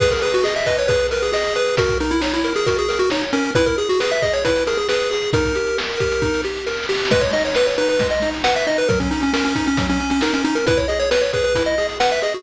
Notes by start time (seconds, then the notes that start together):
0.00 G#4 B4, kick, crash
0.10 A#4, kick, closed hi-hat
0.22 G#4 B4, closed hi-hat
0.34 F#4, closed hi-hat
0.44 G#4 D#5, snare
0.56 E5, closed hi-hat
0.66 B4 D#5, kick, closed hi-hat
0.77 C#5, closed hi-hat
0.88 G#4 B4, kick, closed hi-hat
0.99 closed hi-hat
1.11 A#4 B4, closed hi-hat
1.22 G#4, closed hi-hat
1.32 G#4 D#5, snare
1.44 closed hi-hat
1.55 B4, closed hi-hat
1.66 closed hi-hat
1.77 F#4 A#4, kick, closed hi-hat
1.89 kick, closed hi-hat
2.00 D#4 A#4, closed hi-hat
2.11 E4, closed hi-hat
2.21 D#4 C#5, snare
2.33 E4, closed hi-hat
2.44 A#4, closed hi-hat
2.55 G#4, closed hi-hat
2.66 F#4 A#4, kick, closed hi-hat
2.77 G#4, closed hi-hat
2.89 A#4, closed hi-hat
2.99 F#4, closed hi-hat
3.10 D#4 C#5, snare
3.23 closed hi-hat
3.33 C#4 A#4, closed hi-hat
3.45 closed hi-hat
3.55 E4 B4, kick, closed hi-hat
3.66 A#4, kick, closed hi-hat
3.78 G#4, closed hi-hat
3.89 F#4, closed hi-hat
4.00 G#4 B4, snare
4.11 E5, closed hi-hat
4.22 G#4 D#5, kick, closed hi-hat
4.33 C#5, closed hi-hat
4.45 E4 B4, kick, closed hi-hat
4.56 closed hi-hat
4.67 G#4 A#4, closed hi-hat
4.77 G#4, closed hi-hat
4.89 G#4 B4, snare
5.00 closed hi-hat
5.11 G#4, closed hi-hat
5.22 closed hi-hat
5.33 D#4 A#4, kick, closed hi-hat
5.45 kick, closed hi-hat
5.55 G4, closed hi-hat
5.67 closed hi-hat
5.78 A#4, snare
5.89 closed hi-hat
5.99 G4, kick, closed hi-hat
6.11 closed hi-hat
6.22 D#4, kick, snare
6.34 snare
6.44 G4, snare
6.56 snare
6.66 A#4, snare
6.73 snare
6.77 snare
6.83 snare
6.89 G4, snare
6.94 snare
6.99 snare
7.05 snare
7.11 G#3 B4, kick, crash
7.21 C#5, kick, closed hi-hat
7.33 D#4 D#5, closed hi-hat
7.45 C#5, closed hi-hat
7.55 B4, snare
7.66 C#5, closed hi-hat
7.78 D#4 B4, closed hi-hat
7.89 B4, closed hi-hat
7.99 G#3, kick, closed hi-hat
8.10 D#5, closed hi-hat
8.22 D#4, closed hi-hat
8.34 closed hi-hat
8.44 B4 F#5, snare
8.55 E5, closed hi-hat
8.67 D#4 D#5, closed hi-hat
8.78 B4, closed hi-hat
8.89 F#3 A#4, kick, closed hi-hat
9.00 C#4, kick, closed hi-hat
9.11 C#4 D#4, closed hi-hat
9.21 C#4, closed hi-hat
9.33 C#4 A#4, snare
9.45 C#4, closed hi-hat
9.55 C#4 D#4, kick, closed hi-hat
9.66 C#4, closed hi-hat
9.77 F#3, kick, closed hi-hat
9.89 C#4, closed hi-hat
10.00 C#4, closed hi-hat
10.10 C#4, closed hi-hat
10.21 D#4 A#4, snare
10.33 C#4, closed hi-hat
10.44 C#4 D#4, closed hi-hat
10.55 A#4, closed hi-hat
10.66 E4 B4, kick, closed hi-hat
10.77 C#5, kick, closed hi-hat
10.88 G#4 D#5, closed hi-hat
11.00 C#5, closed hi-hat
11.11 B4, snare
11.21 C#5, closed hi-hat
11.33 G#4 B4, kick, closed hi-hat
11.44 B4, closed hi-hat
11.55 E4, kick, closed hi-hat
11.66 D#5, closed hi-hat
11.78 G#4, closed hi-hat
11.89 closed hi-hat
12.00 B4 F#5, snare
12.10 E5, closed hi-hat
12.21 G#4 D#5, closed hi-hat
12.33 F#4, closed hi-hat